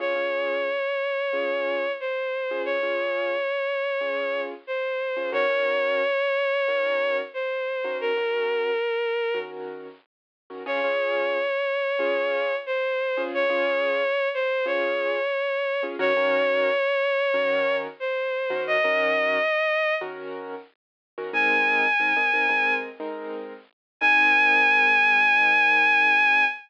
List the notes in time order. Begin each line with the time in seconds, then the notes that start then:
0.00 C#4 F4 G#4 C#5
0.15 C#4 F4 G#4
1.33 C#4 F4 G#4
2.00 C5
2.51 C#4 F4 G#4
2.65 C#5
2.83 C#4 F4 G#4
4.01 C#4 F4 G#4
4.67 C5
5.17 C#4 F4 G#4
5.32 D#3 C#4 F#4 A#4 C#5
5.49 D#3 C#4 F#4 A#4
6.68 D#3 C#4 F#4 A#4
7.34 C5
7.84 D#3 C#4 F#4 A#4
8.01 A#4
8.17 D#3 C#4 F#4 A#4
9.34 D#3 C#4 F#4 A#4
10.50 D#3 C#4 F#4 A#4
10.66 C#4 F4 G#4 C#5
10.84 C#4 F4 G#4
11.99 C#4 F4 G#4
12.66 C5
13.17 C#4 F4 G#4
13.34 C#5
13.50 C#4 F4 G#4
14.34 C5
14.66 C#4 F4 G#4 C#5
15.83 C#4 F4 G#4
15.99 D#3 C#4 F#4 A#4 C#5
16.17 D#3 C#4 F#4 A#4
17.34 D#3 C#4 F#4 A#4
18.00 C5
18.50 D#3 C#4 F#4 A#4
18.67 D#5
18.84 D#3 C#4 F#4 A#4
20.01 D#3 C#4 F#4 A#4
21.18 D#3 C#4 F#4 A#4
21.33 G#3 C4 D#4 A#4 G#5
22.00 G#3 C4 D#4 A#4
22.17 G#3 C4 D#4 A#4
22.34 G#3 C4 D#4 A#4
22.49 G#3 C4 D#4 A#4
23.00 G#3 C4 D#4 A#4
24.01 G#3 C4 D#4 A#4 G#5